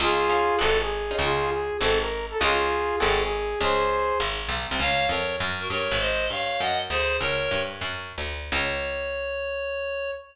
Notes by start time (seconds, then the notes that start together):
0.00 C#2 C#4 D#4 F4 G#4
0.29 C#4 D#4 F4 G#4
0.59 G#1 C4 F#4 G#4 A4
0.81 G#4
1.11 C#4 D#4 F4 G#4
1.19 C#2 F4 G#4
1.51 G#4
1.80 G#1 C4 F#4 G#4 A4
2.01 A#4
2.30 A4
2.39 C#2 C#4 D#4 F4 G#4
3.00 G#1 C4 F#4 G#4 A4
3.21 G#4
3.61 C#2 G#4 C5
4.20 G#1
4.49 B1
4.71 C2
4.79 C#2 C#5 F5
5.09 F2 A#4 C#5
5.40 F#2
5.60 F#4 A#4
5.70 G2 A#4 C#5
5.91 G#1
5.99 C5 D#5
6.30 G2 C#5 F5
6.60 F#2 D#5 F#5
6.90 D2 G#4 C5
7.20 C#2 A#4 C#5
7.51 G2
7.81 F#2
8.18 D2
8.52 C#2 C#5